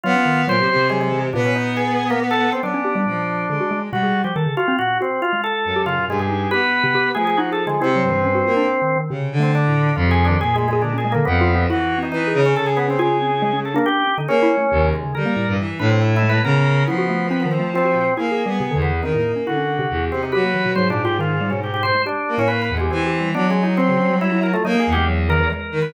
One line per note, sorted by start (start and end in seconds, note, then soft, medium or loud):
0.03 0.14 F#3 loud
0.03 0.44 B3 loud
0.03 0.42 F4 loud
0.15 0.25 C#4 medium
0.26 0.45 D#3 medium
0.47 0.56 A#2 medium
0.47 0.61 F#3 loud
0.47 0.88 C5 loud
0.58 0.68 C3 medium
0.58 0.75 F#3 medium
0.70 1.28 C3 medium
0.76 0.89 C3 medium
0.90 1.10 F#3 medium
0.90 0.99 G#3 loud
1.01 1.21 G#3 medium
1.12 1.31 E3 medium
1.33 2.50 A#2 loud
1.33 2.51 B3 loud
1.33 1.43 D4 soft
1.45 1.54 C#4 medium
1.55 1.74 D#4 medium
1.77 2.06 G#4 medium
2.10 2.20 A#3 loud
2.31 2.50 A4 loud
2.52 2.62 C4 medium
2.62 2.73 F#3 medium
2.62 3.01 B3 medium
2.62 3.80 D4 medium
2.74 2.84 C#4 loud
2.85 2.94 G4 medium
2.95 3.05 G3 loud
3.06 3.45 A#2 medium
3.06 3.46 F3 medium
3.49 3.59 D3 medium
3.49 3.88 G#3 medium
3.60 3.70 F#4 medium
3.71 3.90 G#3 medium
3.91 4.02 B2 loud
3.91 4.20 G3 medium
3.91 4.22 F#4 medium
4.03 4.22 G#4 medium
4.24 4.34 F3 medium
4.24 4.34 G4 medium
4.36 4.45 D#3 loud
4.36 4.55 A4 medium
4.46 4.56 C#3 medium
4.57 4.76 F4 loud
4.57 4.67 F#4 loud
4.68 4.78 C4 loud
4.79 4.99 A#2 medium
4.79 4.98 F#4 loud
5.01 5.21 C4 medium
5.01 5.20 F#4 medium
5.22 5.32 F4 medium
5.22 5.41 F4 loud
5.33 5.72 G#3 medium
5.44 5.82 A4 loud
5.65 6.04 F#2 medium
5.76 5.86 G4 medium
5.86 5.96 C#3 medium
5.86 6.05 F4 loud
5.98 6.27 B2 medium
6.08 6.47 G2 medium
6.08 6.19 G#3 loud
6.19 6.48 G#4 medium
6.30 6.50 D#4 medium
6.51 7.10 B3 medium
6.51 6.61 G4 loud
6.51 7.09 B4 loud
6.84 6.93 C3 loud
6.95 7.14 G4 loud
7.15 7.74 F3 soft
7.15 7.36 A3 medium
7.15 7.24 G#4 loud
7.27 7.37 G#4 loud
7.37 7.51 D#4 loud
7.37 7.50 F#4 medium
7.52 7.65 G#4 medium
7.52 7.65 A4 medium
7.67 7.79 D3 medium
7.67 7.80 G#3 loud
7.81 8.01 C3 medium
7.81 8.98 C4 loud
7.81 7.94 E4 medium
7.96 8.09 F#3 medium
8.03 8.42 G2 medium
8.10 8.23 E3 loud
8.24 8.34 C#4 medium
8.35 8.45 F#4 medium
8.46 8.65 A#3 medium
8.46 8.55 F4 medium
8.57 8.66 D4 loud
8.67 8.80 D4 soft
8.82 8.95 D#3 medium
8.96 9.09 D#3 medium
9.10 9.36 C3 loud
9.10 9.30 C#3 medium
9.32 9.90 D3 medium
9.40 9.65 A3 medium
9.40 9.52 C4 medium
9.55 9.94 D4 medium
9.68 9.94 A2 medium
9.96 10.35 F2 loud
9.96 10.06 E3 medium
9.96 10.09 F4 medium
10.07 10.27 C3 medium
10.07 10.24 G#4 loud
10.25 10.38 D4 loud
10.29 10.39 D#3 medium
10.40 11.18 A#2 medium
10.40 10.59 G#4 medium
10.40 10.54 G#4 loud
10.56 10.68 G#3 loud
10.62 10.72 A3 soft
10.68 10.81 G#3 medium
10.73 10.82 G#4 loud
10.82 10.93 D3 medium
10.82 10.95 D4 medium
10.94 11.03 C#4 medium
10.98 11.11 G#4 medium
11.05 11.14 G#3 medium
11.12 11.25 D3 loud
11.12 11.25 A#3 loud
11.25 11.65 F2 loud
11.25 11.39 F3 medium
11.25 11.64 B3 medium
11.41 11.54 F4 loud
11.55 11.68 C4 loud
11.70 12.09 E3 medium
11.70 11.96 E4 loud
11.70 11.99 F#4 medium
11.98 12.24 C4 medium
12.03 12.11 D#4 medium
12.12 12.31 E3 medium
12.12 12.41 D#4 medium
12.27 12.53 G#4 medium
12.34 12.53 C#3 loud
12.46 12.55 C#4 medium
12.56 12.96 C#3 medium
12.56 12.66 A4 loud
12.66 12.76 G#4 medium
12.77 12.87 B3 medium
12.88 13.00 C4 medium
12.88 12.98 C#4 medium
12.99 13.77 C#3 medium
12.99 13.19 F4 loud
12.99 13.57 G#4 medium
13.21 13.30 C4 medium
13.42 13.52 G#3 loud
13.53 13.72 C#4 medium
13.65 13.75 A4 medium
13.74 13.85 A#3 loud
13.74 14.04 D4 loud
13.86 14.15 G4 loud
14.07 14.17 C#4 soft
14.18 14.27 D3 medium
14.18 14.28 D#4 medium
14.28 14.47 A#3 loud
14.28 14.87 C#4 loud
14.28 14.42 G#4 medium
14.43 14.56 E4 loud
14.58 14.71 A3 medium
14.71 14.91 D#2 loud
14.71 15.01 C3 medium
14.93 15.12 G#3 medium
15.04 15.14 C#3 medium
15.15 15.25 D3 medium
15.15 15.45 G3 medium
15.15 15.53 A#4 medium
15.26 15.35 A#3 loud
15.36 15.56 A2 medium
15.48 15.57 G2 medium
15.59 15.78 E3 medium
15.79 16.38 A2 loud
15.79 16.19 D4 medium
15.79 15.89 B4 medium
15.90 16.00 C4 medium
16.02 16.14 E4 medium
16.16 16.29 E4 loud
16.22 16.42 G#3 medium
16.29 16.42 B4 loud
16.44 16.83 C#3 loud
16.44 16.83 B3 medium
16.44 16.84 A#4 loud
16.87 18.04 F3 medium
16.87 17.27 B3 medium
16.87 16.97 E4 medium
16.98 17.08 F#4 loud
17.09 17.29 A3 medium
17.31 17.44 C4 loud
17.31 17.41 B4 medium
17.40 17.50 B3 medium
17.45 17.58 D#3 medium
17.51 17.71 C4 medium
17.60 17.73 A3 medium
17.74 18.14 C4 loud
17.74 17.84 F4 medium
17.85 17.94 F#4 medium
17.95 18.15 A#2 medium
18.17 18.43 A#3 medium
18.17 18.30 E4 medium
18.17 18.75 G#4 medium
18.31 18.44 G#4 medium
18.46 18.59 G3 medium
18.46 18.72 B3 medium
18.60 18.70 C3 loud
18.71 19.00 E2 medium
18.71 18.90 D3 loud
18.82 19.01 B3 medium
19.03 19.13 D#3 medium
19.03 19.13 C4 medium
19.03 19.32 D#4 medium
19.14 19.34 A2 medium
19.14 19.44 A#3 medium
19.36 19.46 C#4 medium
19.47 19.86 D3 soft
19.47 19.56 E4 medium
19.47 20.05 F#4 medium
19.57 19.76 C#4 medium
19.79 19.89 C3 loud
19.90 20.09 E2 medium
20.11 20.31 C3 medium
20.11 20.22 C4 medium
20.23 20.32 D#4 medium
20.32 20.72 F#3 medium
20.32 20.42 G4 loud
20.32 20.71 B4 medium
20.44 20.53 A#3 medium
20.54 20.64 E3 medium
20.66 20.75 B2 medium
20.75 21.92 G#2 medium
20.75 20.89 F#3 loud
20.75 20.88 C5 medium
20.90 21.03 A#2 loud
20.90 21.03 D4 medium
21.05 21.18 F4 loud
21.05 21.18 G4 medium
21.19 21.38 D#3 medium
21.19 21.50 F4 medium
21.41 21.51 G3 medium
21.50 21.81 B2 medium
21.50 21.60 C#4 medium
21.63 21.73 G4 soft
21.74 21.83 G4 medium
21.83 21.93 B2 medium
21.83 22.02 C5 loud
21.95 22.04 G#3 medium
22.06 22.35 D4 medium
22.06 22.35 G4 medium
22.28 22.67 A#3 medium
22.38 22.77 A2 loud
22.38 22.48 C#4 loud
22.48 22.61 B4 medium
22.62 22.75 B4 medium
22.69 22.89 E2 medium
22.77 22.90 G#3 medium
22.77 22.91 G4 medium
22.91 23.30 E3 loud
22.91 23.29 C4 medium
22.91 23.05 G4 medium
23.06 23.19 G4 medium
23.21 23.34 G3 medium
23.34 24.52 F#3 medium
23.34 23.48 B3 medium
23.34 23.47 D4 medium
23.49 23.63 G#3 medium
23.49 23.62 C#4 medium
23.63 23.76 D#4 medium
23.63 23.77 E4 medium
23.77 24.16 C4 loud
23.77 23.88 C4 loud
23.89 23.99 C#3 medium
24.00 24.09 C#4 medium
24.10 24.30 G3 medium
24.21 24.41 E4 loud
24.32 24.51 E4 medium
24.43 24.53 A#4 medium
24.53 24.63 A3 loud
24.53 24.63 F4 medium
24.65 24.74 F#3 medium
24.65 24.84 A#3 loud
24.65 24.78 D#4 medium
24.75 24.95 A#3 medium
24.79 24.92 G#4 medium
24.87 25.45 E2 medium
24.92 25.05 G4 loud
24.97 25.07 G#3 medium
25.08 25.27 F#3 medium
25.29 25.39 D#3 loud
25.29 25.49 A#4 loud
25.40 25.49 E3 loud
25.50 25.90 G#3 medium
25.50 25.79 A#4 medium
25.72 25.91 D#3 medium
25.82 25.92 B4 medium